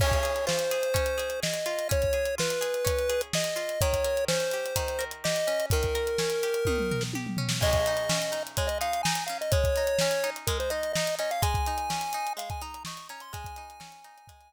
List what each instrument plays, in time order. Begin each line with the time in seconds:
0.00 pizzicato strings C#4, lead 1 (square) C#5, kick, crash
0.12 kick, closed hi-hat
0.23 pizzicato strings G#4, closed hi-hat
0.36 closed hi-hat
0.47 pizzicato strings F4, lead 1 (square) C5, snare
0.59 closed hi-hat
0.71 pizzicato strings G#4, closed hi-hat
0.83 closed hi-hat
0.94 pizzicato strings C#4, kick, closed hi-hat
1.06 closed hi-hat
1.18 pizzicato strings G#4, closed hi-hat
1.30 closed hi-hat
1.43 pizzicato strings G#4, lead 1 (square) D#5, snare
1.54 closed hi-hat
1.66 pizzicato strings F4, closed hi-hat
1.79 closed hi-hat
1.89 pizzicato strings C#4, lead 1 (square) C#5, kick, closed hi-hat
2.02 kick, closed hi-hat
2.13 pizzicato strings G#4, closed hi-hat
2.25 closed hi-hat
2.38 pizzicato strings F4, lead 1 (square) B4, snare
2.50 closed hi-hat
2.61 pizzicato strings G#4, closed hi-hat
2.74 closed hi-hat
2.85 pizzicato strings C#4, kick, closed hi-hat
2.99 closed hi-hat
3.09 pizzicato strings G#4, closed hi-hat
3.21 closed hi-hat
3.33 pizzicato strings G#4, lead 1 (square) D#5, snare
3.44 closed hi-hat
3.56 pizzicato strings F4, closed hi-hat
3.69 closed hi-hat
3.81 pizzicato strings D#3, lead 1 (square) C#5, kick, closed hi-hat
3.93 kick, closed hi-hat
4.04 pizzicato strings A#4, closed hi-hat
4.17 closed hi-hat
4.28 pizzicato strings C#4, lead 1 (square) C5, snare
4.40 closed hi-hat
4.51 pizzicato strings G4, closed hi-hat
4.66 closed hi-hat
4.76 pizzicato strings D#3, kick, closed hi-hat
4.88 closed hi-hat
4.99 pizzicato strings A#4, closed hi-hat
5.11 closed hi-hat
5.24 pizzicato strings G4, lead 1 (square) D#5, snare
5.36 closed hi-hat
5.47 pizzicato strings C#4, closed hi-hat
5.60 closed hi-hat
5.70 pizzicato strings D#3, lead 1 (square) A#4, kick, closed hi-hat
5.83 kick, closed hi-hat
5.95 pizzicato strings A#4, closed hi-hat
6.07 closed hi-hat
6.18 pizzicato strings C#4, snare
6.30 closed hi-hat
6.43 pizzicato strings G4, closed hi-hat
6.54 closed hi-hat
6.65 pizzicato strings D#3, kick, high tom
6.78 mid tom
6.91 pizzicato strings A#4, floor tom
7.01 snare
7.13 pizzicato strings G4, high tom
7.27 mid tom
7.37 pizzicato strings C#4, floor tom
7.49 snare
7.61 pizzicato strings G#3, lead 1 (square) D#5, kick, crash
7.73 kick, closed hi-hat
7.86 pizzicato strings D#4, closed hi-hat
7.97 closed hi-hat
8.09 pizzicato strings C#4, snare
8.22 closed hi-hat
8.32 pizzicato strings D#4, closed hi-hat
8.47 closed hi-hat
8.57 pizzicato strings G#3, lead 1 (square) C#5, kick, closed hi-hat
8.67 lead 1 (square) D#5, closed hi-hat
8.81 pizzicato strings D#4, lead 1 (square) F5, closed hi-hat
8.93 closed hi-hat
9.03 pizzicato strings D#4, lead 1 (square) G#5, snare
9.15 closed hi-hat
9.26 pizzicato strings C#4, lead 1 (square) F5, closed hi-hat
9.41 lead 1 (square) D#5, closed hi-hat
9.52 pizzicato strings G#3, lead 1 (square) C#5, kick, closed hi-hat
9.64 kick, closed hi-hat
9.76 pizzicato strings D#4, closed hi-hat
9.87 closed hi-hat
9.99 pizzicato strings C#4, snare
10.11 closed hi-hat
10.24 pizzicato strings D#4, closed hi-hat
10.36 closed hi-hat
10.47 pizzicato strings G#3, lead 1 (square) A#4, kick, closed hi-hat
10.60 lead 1 (square) C5, closed hi-hat
10.70 pizzicato strings D#4, lead 1 (square) D#5, closed hi-hat
10.83 closed hi-hat
10.93 pizzicato strings D#4, lead 1 (square) D#5, snare
11.07 closed hi-hat
11.19 pizzicato strings C#4, lead 1 (square) D#5, closed hi-hat
11.31 lead 1 (square) F5, closed hi-hat
11.42 pizzicato strings G#3, lead 1 (square) G#5, kick, closed hi-hat
11.54 kick, closed hi-hat
11.66 pizzicato strings D#4, closed hi-hat
11.78 closed hi-hat
11.90 pizzicato strings C#4, snare
12.01 closed hi-hat
12.13 pizzicato strings D#4, closed hi-hat
12.27 closed hi-hat
12.37 pizzicato strings G#3, lead 1 (square) F5, closed hi-hat
12.50 lead 1 (square) G#5, kick, closed hi-hat
12.62 pizzicato strings D#4, lead 1 (square) A#5, closed hi-hat
12.74 closed hi-hat
12.85 pizzicato strings D#4, lead 1 (square) C#6, snare
12.97 closed hi-hat
13.09 pizzicato strings C#4, lead 1 (square) A#5, closed hi-hat
13.20 lead 1 (square) C6, closed hi-hat
13.33 pizzicato strings G#3, lead 1 (square) G#5, kick, closed hi-hat
13.44 kick, closed hi-hat
13.56 pizzicato strings D#4, closed hi-hat
13.70 closed hi-hat
13.80 pizzicato strings C#4, snare
13.92 closed hi-hat
14.04 pizzicato strings D#4, closed hi-hat
14.18 closed hi-hat
14.27 pizzicato strings G#3, kick, closed hi-hat
14.41 closed hi-hat